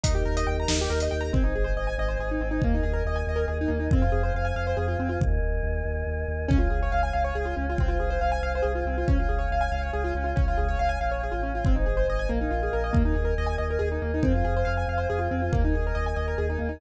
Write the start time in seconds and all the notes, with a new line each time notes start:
0.03 D#2 D#4 G4 A#4, kick, closed hi-hat
0.15 G4
0.25 D#2 A#4
0.37 D#5, closed hi-hat
0.47 D#2 G5
0.60 A#5
0.68 D#2 D#4, snare
0.81 G4
0.90 D#2 A#4
1.00 D#5, closed hi-hat
1.11 D#2 G5
1.21 A#5
1.33 G#1 C4 C5 D#5 G#5, kick
1.44 D#4
1.55 G#1 G#4
1.64 C5
1.76 G#1 D#5
1.87 G#5
1.98 G#1 D#5
2.08 C5
2.19 G#1 G#4
2.31 D#4
2.41 G#1 C4
2.51 D#4
2.62 D#2 A#3 A#4 D#5 G#5, kick
2.74 D#4
2.83 D#2 G#4
2.93 A#4
3.05 D#2 D#5
3.16 G#5
3.27 D#2 D#5
3.36 A#4
3.48 D#2 G#4
3.61 D#4
3.68 D#2 A#3
3.79 D#4
3.91 F2 C4 C5 F5 G#5, kick
4.02 F4
4.12 F2 G#4
4.23 C5
4.34 F2 F5
4.45 G#5
4.56 F2 F5
4.67 C5
4.77 F2 G#4
4.88 F4
4.99 F2 C4
5.09 F4
5.20 D#2 A#4 D#5 G#5, kick
5.42 D#2
5.63 D#2
5.85 D#2
6.07 D#2
6.28 D#2
6.48 C#2 C#4 C#5 F5 G#5, kick
6.59 F4
6.70 C#2 G#4
6.83 C#5
6.92 C#2 F5
7.03 G#5
7.13 C#2 F5
7.24 C#5
7.35 C#2 G#4
7.45 F4
7.56 C#2 C#4
7.70 F4
7.78 C2 C4 C5 F5 G#5, kick
7.88 F4
8.00 C2 G#4
8.10 C5
8.21 C2 F5
8.32 G#5
8.43 C2 F5
8.55 C5
8.62 C2 G#4
8.75 F4
8.85 C2 C4
8.98 F4
9.08 C#2 C#4 C#5 F5 G#5, kick
9.19 F4
9.29 C#2 G#4
9.39 C#5
9.51 C#2 F5
9.61 G#5
9.72 C#2 F5
9.82 C#5
9.93 C#2 G#4
10.04 F4
10.15 C#2 C#4
10.24 F4
10.36 C#2 C#4 C#5 F5 G#5, kick
10.48 F4
10.58 C#2 G#4
10.69 C#5
10.79 C#2 F5
10.89 G#5
11.01 A#1 F5
11.11 C#5
11.23 G#4
11.32 A1 F4
11.43 C#4
11.55 F4
11.65 G#1 C4 C5 D#5 G#5, kick
11.76 D#4
11.86 G#1 G#4
11.97 C5
12.08 G#1 D#5
12.19 G#5
12.29 A#1 A#3 A#4 D#5 F5 G#5
12.41 D#4
12.51 A#1 F4
12.63 G#4
12.73 A#1 A#4
12.84 D#5
12.93 D#2 A#3 A#4 D#5 G#5, kick
13.05 D#4
13.15 D#2 G#4
13.25 A#4
13.38 D#2 D#5
13.47 G#5
13.58 D#2 D#5
13.70 A#4
13.79 D#2 G#4
13.92 D#4
14.02 D#2 A#3
14.14 D#4
14.23 F2 C4 C5 F5 G#5, kick
14.35 F4
14.45 F2 G#4
14.57 C5
14.65 F2 F5
14.77 G#5
14.88 F2 F5
14.98 C5
15.10 F2 G#4
15.19 F4
15.31 F2 C4
15.42 F4
15.53 D#2 A#3 A#4 D#5 G#5, kick
15.65 D#4
15.74 D#2 G#4
15.87 A#4
15.95 D#2 D#5
16.06 G#5
16.16 D#2 D#5
16.28 A#4
16.38 D#2 G#4
16.50 D#4
16.59 D#2 A#3
16.69 D#4